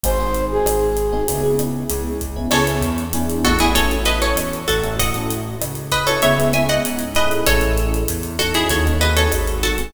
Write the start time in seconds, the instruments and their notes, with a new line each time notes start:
0.03 synth bass 1 G#1, electric piano 1 C4 D#4 F#4 G#4, flute C5, kick, closed hi-hat
0.20 electric piano 1 C4 D#4 F#4 G#4
0.35 closed hi-hat
0.51 flute G#4
0.65 synth bass 1 G#1, cross-stick, closed hi-hat
0.97 closed hi-hat
1.12 electric piano 1 C4 D#4 F#4 G#4
1.28 synth bass 1 C#2, electric piano 1 B3 C#4 E4 G#4, kick, closed hi-hat
1.43 electric piano 1 B3 C#4 E4 G#4
1.59 electric piano 1 B3 C#4 E4 G#4, cross-stick, closed hi-hat
1.90 synth bass 1 C#2, closed hi-hat
2.21 kick, closed hi-hat
2.36 electric piano 1 B3 C#4 E4 G#4
2.51 synth bass 1 C#2, electric piano 1 B3 C#4 E4 G#4, acoustic guitar (steel) A4 C#5, cross-stick, crash
2.67 electric piano 1 B3 C#4 E4 G#4, closed hi-hat
2.81 synth bass 1 E2, closed hi-hat
2.98 closed hi-hat
3.13 electric piano 1 B3 D4 E4 G#4, closed hi-hat
3.30 closed hi-hat
3.45 synth bass 1 A1, acoustic guitar (steel) F#4 A4, kick, cross-stick, closed hi-hat
3.59 electric piano 1 B3 D4 E4 G#4, acoustic guitar (steel) E4 G#4, closed hi-hat
3.75 electric piano 1 C#4 E4 F#4 A4, acoustic guitar (steel) A4 C#5, kick, closed hi-hat
3.91 electric piano 1 C#4 E4 F#4 A4, closed hi-hat
4.05 electric piano 1 C#4 E4 F#4 A4, acoustic guitar (steel) B4 D#5, closed hi-hat
4.22 acoustic guitar (steel) A4 C#5, closed hi-hat
4.35 synth bass 1 E2, cross-stick, closed hi-hat
4.53 closed hi-hat
4.68 synth bass 1 A1, acoustic guitar (steel) F#4 A4, kick, closed hi-hat
4.84 electric piano 1 C#4 E4 F#4 A4, closed hi-hat
4.99 electric piano 1 C#4 E4 F#4 A4, acoustic guitar (steel) D#5 F#5, kick, closed hi-hat
5.14 electric piano 1 C#4 E4 F#4 A4, closed hi-hat
5.30 closed hi-hat
5.61 synth bass 1 C#2, cross-stick, closed hi-hat
5.75 closed hi-hat
5.91 acoustic guitar (steel) B4 D#5, kick, closed hi-hat
6.07 electric piano 1 C#4 E4 F#4 A4, acoustic guitar (steel) A4 C#5, closed hi-hat
6.22 synth bass 1 C#2, electric piano 1 B3 C#4 E4 G#4, acoustic guitar (steel) C#5 E5, kick, closed hi-hat
6.38 electric piano 1 B3 C#4 E4 G#4, closed hi-hat
6.53 electric piano 1 B3 C#4 E4 G#4, acoustic guitar (steel) E5 G#5, cross-stick, closed hi-hat
6.69 acoustic guitar (steel) D#5 F#5, closed hi-hat
6.85 synth bass 1 G#2, closed hi-hat
6.99 closed hi-hat
7.15 electric piano 1 C#4 E4 G#4 A4, acoustic guitar (steel) B4 D#5, kick, closed hi-hat
7.31 closed hi-hat
7.47 synth bass 1 A1, acoustic guitar (steel) A4 C#5, kick, cross-stick, closed hi-hat
7.61 electric piano 1 C#4 E4 G#4 A4, closed hi-hat
7.78 closed hi-hat
7.94 closed hi-hat
8.08 synth bass 1 E2, closed hi-hat
8.23 closed hi-hat
8.39 electric piano 1 C#4 D#4 F#4 A4, acoustic guitar (steel) F#4 A4, kick, cross-stick, closed hi-hat
8.54 acoustic guitar (steel) E4 G#4, closed hi-hat
8.69 synth bass 1 D#2, acoustic guitar (steel) A4 C#5, kick, closed hi-hat
8.86 electric piano 1 C#4 D#4 F#4 A4, closed hi-hat
9.01 electric piano 1 C4 D#4 F#4 G#4, acoustic guitar (steel) B4 D#5, closed hi-hat
9.16 acoustic guitar (steel) A4 C#5, closed hi-hat
9.32 synth bass 1 G#1, cross-stick, closed hi-hat
9.47 closed hi-hat
9.63 acoustic guitar (steel) F#4 A4, kick, closed hi-hat
9.78 electric piano 1 C4 D#4 F#4 G#4, closed hi-hat